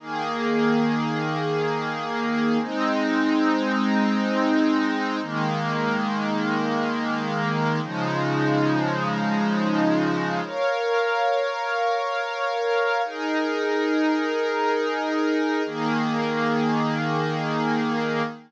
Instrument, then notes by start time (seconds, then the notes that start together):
pad 5 (bowed)
0.00 D#3 A#3 G#4
2.61 G#3 C4 D#4
5.22 D#3 G#3 A#3
7.83 C#3 F3 G#3 D#4
10.44 A#4 C#5 F5
13.04 D#4 G#4 A#4
15.65 D#3 A#3 G#4